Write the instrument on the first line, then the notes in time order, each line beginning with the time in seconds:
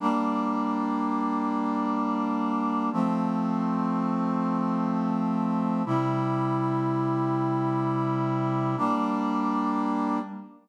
brass section
0.00 G3 A#3 D4
2.92 F3 A3 C4
5.85 C3 G3 E4
8.77 G3 A#3 D4